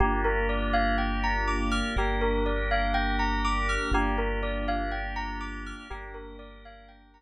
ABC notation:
X:1
M:4/4
L:1/16
Q:1/4=61
K:Gphr
V:1 name="Tubular Bells"
G B d f g b d' f' G B d f g b d' f' | G B d f g b d' f' G B d f g b z2 |]
V:2 name="Drawbar Organ"
[B,DFG]8 [B,DGB]8 | [B,DFG]8 [B,DGB]8 |]
V:3 name="Synth Bass 2" clef=bass
G,,,8 G,,,8 | G,,,8 G,,,8 |]